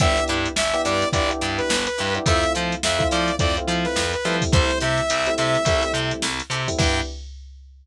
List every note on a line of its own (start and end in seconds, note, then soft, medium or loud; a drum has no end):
0.00 0.19 G1 medium
0.00 0.48 B3 loud
0.00 0.12 D4 loud
0.00 0.48 D4 loud
0.00 0.12 E4 loud
0.00 0.48 E4 loud
0.00 0.12 G4 loud
0.00 0.48 G4 loud
0.00 0.12 B4 loud
0.00 0.24 E5 loud
0.00 kick loud
0.00 closed hi-hat loud
0.17 closed hi-hat medium
0.28 0.47 G2 medium
0.28 0.50 D4 medium
0.28 0.50 E4 loud
0.28 0.50 G4 loud
0.28 0.50 B4 loud
0.28 closed hi-hat medium
0.46 closed hi-hat medium
0.56 0.74 G1 medium
0.56 0.82 E5 loud
0.56 snare loud
0.74 1.06 B3 loud
0.74 1.06 D4 medium
0.74 1.06 E4 medium
0.74 1.06 G4 loud
0.74 snare soft
0.74 closed hi-hat medium
0.85 1.04 G2 medium
0.85 1.06 D4 medium
0.85 1.06 E4 loud
0.85 1.06 G4 loud
0.85 1.06 B4 medium
0.85 1.09 D5 loud
0.85 closed hi-hat medium
1.02 snare soft
1.02 closed hi-hat medium
1.13 1.31 G1 medium
1.13 1.27 B3 medium
1.13 1.27 D4 medium
1.13 1.27 E4 medium
1.13 1.27 G4 medium
1.13 1.30 D5 loud
1.13 kick loud
1.13 closed hi-hat loud
1.29 1.71 B3 medium
1.29 1.71 D4 medium
1.29 1.71 E4 medium
1.29 1.71 G4 medium
1.29 closed hi-hat medium
1.41 1.60 G2 medium
1.41 1.63 D4 loud
1.41 1.63 E4 loud
1.41 1.63 G4 loud
1.41 1.63 B4 loud
1.41 snare soft
1.41 closed hi-hat medium
1.58 1.85 B4 loud
1.58 closed hi-hat medium
1.70 1.88 G1 medium
1.70 snare loud
1.86 2.14 B4 loud
1.86 snare soft
1.86 closed hi-hat medium
1.98 2.18 G2 medium
1.98 2.10 D4 medium
1.98 2.10 E4 loud
1.98 2.10 G4 loud
1.98 2.10 B4 medium
1.98 closed hi-hat medium
2.15 2.24 B3 medium
2.15 2.24 D4 medium
2.15 2.24 E4 medium
2.15 2.24 G4 medium
2.15 closed hi-hat medium
2.26 2.44 F2 medium
2.26 2.74 A3 loud
2.26 2.74 C4 loud
2.26 2.74 E4 loud
2.26 2.39 E4 loud
2.26 2.74 F4 loud
2.26 2.39 F4 loud
2.26 2.39 A4 loud
2.26 2.39 C5 loud
2.26 2.53 E5 loud
2.26 kick loud
2.26 closed hi-hat loud
2.43 closed hi-hat medium
2.55 2.75 F3 medium
2.55 2.76 E4 loud
2.55 2.76 F4 loud
2.55 2.76 A4 medium
2.55 2.76 C5 loud
2.55 closed hi-hat medium
2.72 closed hi-hat medium
2.83 3.03 F2 medium
2.83 3.08 E5 loud
2.83 snare loud
2.99 3.32 A3 medium
2.99 3.32 C4 medium
2.99 3.32 E4 medium
2.99 3.32 F4 loud
2.99 kick medium
2.99 closed hi-hat medium
3.11 3.30 F3 medium
3.11 3.33 E4 loud
3.11 3.33 F4 loud
3.11 3.33 A4 loud
3.11 3.33 C5 loud
3.11 3.35 D5 medium
3.11 closed hi-hat medium
3.28 closed hi-hat medium
3.39 3.58 F2 medium
3.39 3.53 A3 medium
3.39 3.53 C4 loud
3.39 3.53 E4 medium
3.39 3.53 F4 medium
3.39 3.56 D5 loud
3.39 kick loud
3.39 closed hi-hat loud
3.57 4.01 A3 medium
3.57 4.01 C4 loud
3.57 4.01 E4 medium
3.57 4.01 F4 medium
3.57 closed hi-hat medium
3.68 3.86 F3 medium
3.68 3.90 E4 loud
3.68 3.90 F4 loud
3.68 3.90 A4 medium
3.68 3.90 C5 loud
3.68 closed hi-hat medium
3.85 4.12 B4 loud
3.85 snare medium
3.85 closed hi-hat medium
3.96 4.14 F2 medium
3.96 snare loud
4.13 4.36 B4 loud
4.13 closed hi-hat medium
4.25 4.43 F3 medium
4.25 5.01 G3 loud
4.25 5.01 A3 loud
4.25 5.01 C4 loud
4.25 4.37 E4 loud
4.25 5.01 E4 loud
4.25 4.37 F4 medium
4.25 4.37 A4 medium
4.25 4.37 C5 medium
4.25 snare soft
4.25 closed hi-hat medium
4.42 kick medium
4.42 open hi-hat medium
4.52 4.71 C2 medium
4.52 4.65 E4 loud
4.52 4.65 G4 loud
4.52 4.65 A4 loud
4.52 4.79 C5 loud
4.52 4.65 C5 loud
4.52 kick loud
4.52 closed hi-hat loud
4.71 snare soft
4.71 closed hi-hat medium
4.80 5.00 C3 medium
4.80 5.02 E4 loud
4.80 5.02 G4 loud
4.80 5.02 A4 loud
4.80 5.02 C5 loud
4.80 5.34 E5 loud
4.80 closed hi-hat medium
4.98 closed hi-hat medium
5.10 5.29 C2 medium
5.10 closed hi-hat loud
5.27 5.60 G3 medium
5.27 5.60 A3 medium
5.27 5.60 C4 medium
5.27 5.60 E4 loud
5.27 closed hi-hat medium
5.38 5.57 C3 medium
5.38 5.59 E4 loud
5.38 5.59 G4 loud
5.38 5.59 A4 loud
5.38 5.59 C5 loud
5.38 5.92 E5 loud
5.38 closed hi-hat medium
5.55 closed hi-hat medium
5.65 5.83 C2 medium
5.65 5.80 G3 loud
5.65 5.80 A3 medium
5.65 5.80 C4 medium
5.65 5.80 E4 loud
5.65 kick loud
5.65 closed hi-hat loud
5.83 6.27 G3 loud
5.83 6.27 A3 medium
5.83 6.27 C4 medium
5.83 6.27 E4 medium
5.83 closed hi-hat medium
5.94 6.12 C3 medium
5.94 6.16 E4 medium
5.94 6.16 G4 loud
5.94 6.16 A4 loud
5.94 6.16 C5 loud
5.94 snare soft
5.94 closed hi-hat medium
6.11 closed hi-hat medium
6.22 6.41 C2 medium
6.22 snare loud
6.40 closed hi-hat medium
6.50 6.68 C3 medium
6.50 6.63 E4 medium
6.50 6.63 G4 loud
6.50 6.63 A4 loud
6.50 6.63 C5 medium
6.50 closed hi-hat medium
6.68 6.77 G3 medium
6.68 6.77 A3 medium
6.68 6.77 C4 medium
6.68 6.77 E4 medium
6.68 kick medium
6.68 open hi-hat medium
6.78 7.00 G2 loud
6.78 7.00 B3 loud
6.78 7.00 D4 medium
6.78 7.01 D4 loud
6.78 7.00 E4 loud
6.78 7.01 E4 loud
6.78 7.00 G4 medium
6.78 7.01 G4 loud
6.78 7.01 B4 medium
6.78 7.01 G5 loud
6.78 kick loud
6.78 crash loud